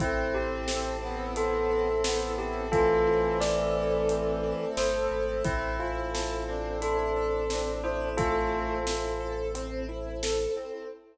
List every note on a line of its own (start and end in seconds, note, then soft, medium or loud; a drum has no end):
0.00 4.54 A1 medium
0.00 1.36 C4 loud
0.00 2.69 C4 medium
0.00 0.96 C4 loud
0.00 2.69 E4 medium
0.00 0.34 E4 loud
0.00 2.69 A4 medium
0.00 kick loud
0.00 closed hi-hat loud
0.34 1.02 E4 medium
0.34 1.20 G4 medium
0.68 2.04 A4 medium
0.68 snare loud
1.02 1.88 B3 loud
1.02 1.70 E4 medium
1.36 2.72 C4 loud
1.36 2.36 A4 medium
1.36 closed hi-hat loud
1.70 2.38 E4 medium
2.04 2.65 B3 loud
2.04 3.40 A4 medium
2.04 snare loud
2.38 3.06 E4 loud
2.38 2.69 G4 medium
2.71 4.65 E3 loud
2.71 5.43 A3 loud
2.71 4.08 C4 loud
2.71 5.43 C4 loud
2.71 3.37 F4 medium
2.71 3.37 A4 medium
2.71 5.43 A4 medium
2.71 kick loud
2.71 closed hi-hat loud
3.07 3.75 E4 medium
3.40 4.77 A4 medium
3.40 4.67 D5 medium
3.40 snare loud
3.75 4.43 E4 medium
4.09 5.38 C4 medium
4.09 closed hi-hat loud
4.43 5.11 E4 loud
4.77 5.08 G1 medium
4.77 5.42 A4 medium
4.77 5.35 C5 medium
4.77 snare loud
5.11 5.42 G#1 medium
5.11 5.43 E4 medium
5.44 10.47 A1 medium
5.44 10.85 C4 medium
5.44 5.76 C4 loud
5.44 5.78 E4 medium
5.44 10.85 E4 medium
5.44 6.44 E4 loud
5.44 10.85 A4 medium
5.44 kick loud
5.44 closed hi-hat loud
5.79 6.10 E4 medium
5.79 6.72 F4 medium
6.14 6.45 A4 medium
6.14 snare loud
6.48 6.79 C4 loud
6.48 7.44 D4 medium
6.82 7.12 E4 loud
6.82 7.71 A4 medium
6.82 closed hi-hat loud
7.16 7.47 A4 medium
7.50 7.81 C4 medium
7.50 8.09 D4 loud
7.50 snare loud
7.84 8.15 E4 medium
7.84 8.13 C5 medium
8.16 8.79 A3 loud
8.16 9.34 F4 medium
8.16 9.34 A4 medium
8.16 8.49 A4 loud
8.16 kick loud
8.16 closed hi-hat loud
8.52 8.83 C4 medium
8.86 9.17 E4 medium
8.86 snare loud
9.20 9.51 A4 medium
9.55 9.85 C4 loud
9.55 closed hi-hat loud
9.89 10.19 E4 medium
10.23 10.54 A4 medium
10.23 snare loud
10.57 10.87 C4 medium